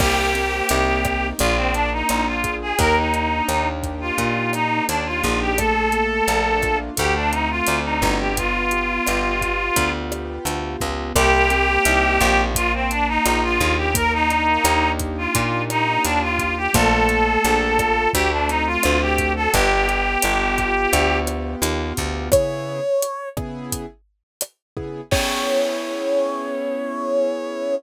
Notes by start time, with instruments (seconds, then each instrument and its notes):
0.00 electric bass (finger) C2, acoustic grand piano A#3, clarinet G4, kick, cross-stick, crash
0.34 acoustic grand piano C4, closed hi-hat
0.69 electric bass (finger) C2, acoustic grand piano D#4, closed hi-hat
1.05 acoustic grand piano G4, kick, cross-stick, closed hi-hat
1.39 electric bass (finger) A#1, acoustic grand piano A#3, clarinet F4, kick, closed hi-hat
1.57 clarinet C4
1.74 clarinet D4, acoustic grand piano D4, closed hi-hat
1.92 clarinet D#4
2.09 electric bass (finger) A#1, acoustic grand piano F4, cross-stick, closed hi-hat
2.27 clarinet F4
2.44 acoustic grand piano G#4, kick, closed hi-hat
2.62 clarinet G#4
2.79 electric bass (finger) D#2, acoustic grand piano A#3, clarinet A#4, kick, closed hi-hat
2.97 clarinet D#4
3.14 acoustic grand piano D4, closed hi-hat
3.49 electric bass (finger) D#2, acoustic grand piano D#4, cross-stick, closed hi-hat
3.83 acoustic grand piano G4, kick, closed hi-hat
4.01 clarinet F4
4.18 electric bass (finger) A#2, acoustic grand piano A#3, kick, closed hi-hat
4.53 acoustic grand piano D4, clarinet D#4, cross-stick, closed hi-hat
4.88 electric bass (finger) D#2, clarinet D4, acoustic grand piano D#4, closed hi-hat
5.06 clarinet F4
5.23 electric bass (finger) A#1, acoustic grand piano G4, kick, closed hi-hat
5.41 clarinet G4
5.58 acoustic grand piano A3, clarinet A4, kick, cross-stick, closed hi-hat
5.92 acoustic grand piano A#3, closed hi-hat
6.28 electric bass (finger) A#1, acoustic grand piano D4, closed hi-hat
6.62 acoustic grand piano F4, kick, cross-stick, closed hi-hat
6.97 electric bass (finger) D2, acoustic grand piano A3, clarinet G4, kick, closed hi-hat
7.15 clarinet D4
7.32 acoustic grand piano C4, clarinet D#4, closed hi-hat
7.50 clarinet F4
7.67 electric bass (finger) D2, acoustic grand piano D4, cross-stick, closed hi-hat
7.85 clarinet D#4
8.02 electric bass (finger) G1, acoustic grand piano F#4, kick, closed hi-hat
8.20 clarinet G4
8.37 acoustic grand piano B3, clarinet F4, kick, closed hi-hat
8.71 acoustic grand piano G4, closed hi-hat
9.06 electric bass (finger) G1, acoustic grand piano B3, cross-stick, closed hi-hat
9.41 acoustic grand piano F4, kick, closed hi-hat
9.76 electric bass (finger) D2, acoustic grand piano B3, kick, closed hi-hat
10.11 acoustic grand piano G4, cross-stick, closed hi-hat
10.45 electric bass (finger) D2, acoustic grand piano F4, closed hi-hat
10.81 electric bass (finger) C#2, acoustic grand piano B3, kick, closed hi-hat
11.15 electric bass (finger) C2, acoustic grand piano A#3, clarinet G4, kick, cross-stick, closed hi-hat
11.50 acoustic grand piano C4, closed hi-hat
11.85 electric bass (finger) C2, acoustic grand piano D#4, closed hi-hat
12.20 electric bass (finger) A#1, acoustic grand piano G4, kick, cross-stick, closed hi-hat
12.55 acoustic grand piano A#3, clarinet F4, kick, closed hi-hat
12.74 clarinet C4
12.91 clarinet D4, acoustic grand piano D4, closed hi-hat
13.08 clarinet D#4
13.25 electric bass (finger) A#1, acoustic grand piano F4, cross-stick, closed hi-hat
13.43 clarinet F4
13.60 electric bass (finger) D#2, acoustic grand piano G#4, kick, closed hi-hat
13.77 clarinet G4
13.94 acoustic grand piano A#3, clarinet A#4, kick, closed hi-hat
14.13 clarinet D#4
14.30 acoustic grand piano D4, closed hi-hat
14.64 electric bass (finger) D#2, acoustic grand piano D#4, cross-stick, closed hi-hat
14.99 acoustic grand piano G4, kick, closed hi-hat
15.18 clarinet F4
15.35 electric bass (finger) A#2, acoustic grand piano A#3, kick, closed hi-hat
15.70 acoustic grand piano D4, clarinet D#4, cross-stick, closed hi-hat
16.04 electric bass (finger) D#2, clarinet D4, acoustic grand piano F4, closed hi-hat
16.22 clarinet F4
16.39 acoustic grand piano G4, kick, closed hi-hat
16.57 clarinet G4
16.73 electric bass (finger) A#1, acoustic grand piano A3, clarinet A4, kick, cross-stick, closed hi-hat
17.09 acoustic grand piano A#3, closed hi-hat
17.44 electric bass (finger) A#1, acoustic grand piano D4, closed hi-hat
17.79 acoustic grand piano F4, kick, cross-stick, closed hi-hat
18.13 electric bass (finger) D2, acoustic grand piano A3, clarinet G4, kick, closed hi-hat
18.32 clarinet D4
18.49 acoustic grand piano C4, clarinet D#4, closed hi-hat
18.66 clarinet F4
18.83 electric bass (finger) D2, acoustic grand piano D4, cross-stick, closed hi-hat
19.01 clarinet G4
19.18 acoustic grand piano F#4, kick, closed hi-hat
19.36 clarinet A4
19.53 electric bass (finger) G1, acoustic grand piano B3, clarinet G4, kick, closed hi-hat
19.88 acoustic grand piano G4, closed hi-hat
20.22 electric bass (finger) G1, acoustic grand piano B3, cross-stick, closed hi-hat
20.58 acoustic grand piano F4, kick, closed hi-hat
20.93 electric bass (finger) D2, acoustic grand piano B3, kick, closed hi-hat
21.27 acoustic grand piano G4, cross-stick, closed hi-hat
21.62 electric bass (finger) D#2, acoustic grand piano F4, closed hi-hat
21.97 electric bass (finger) D2, acoustic grand piano B3, kick, closed hi-hat
22.32 acoustic grand piano C#3 B3 E4 G#4, brass section C#5, kick, cross-stick, closed hi-hat
23.02 closed hi-hat
23.37 acoustic grand piano C#3 B3 E4 G#4, kick, cross-stick
23.72 kick, closed hi-hat
24.41 cross-stick, closed hi-hat
24.77 acoustic grand piano C#3 B3 E4 G#4, kick
25.11 acoustic grand piano B3 C#4 E4 G#4, brass section C#5, kick, crash